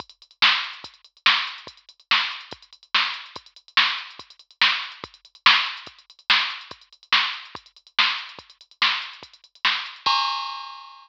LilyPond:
\new DrumStaff \drummode { \time 6/4 \tempo 4 = 143 <hh bd>16 hh16 hh16 hh16 sn16 hh16 hh16 hh16 <hh bd>16 hh16 hh16 hh16 sn16 hh16 hh16 hh16 <hh bd>16 hh16 hh16 hh16 sn16 hh16 hh16 hh16 | <hh bd>16 hh16 hh16 hh16 sn16 hh16 hh16 hh16 <hh bd>16 hh16 hh16 hh16 sn16 hh16 hh16 hh16 <hh bd>16 hh16 hh16 hh16 sn16 hh16 hh16 hh16 | <hh bd>16 hh16 hh16 hh16 sn16 hh16 hh16 hh16 <hh bd>16 hh16 hh16 hh16 sn16 hh16 hh16 hh16 <hh bd>16 hh16 hh16 hh16 sn16 hh16 hh16 hh16 | <hh bd>16 hh16 hh16 hh16 sn16 hh16 hh16 hh16 <hh bd>16 hh16 hh16 hh16 sn16 hh16 hh16 hh16 <hh bd>16 hh16 hh16 hh16 sn16 hh16 hh16 hh16 |
<cymc bd>4 r4 r4 r4 r4 r4 | }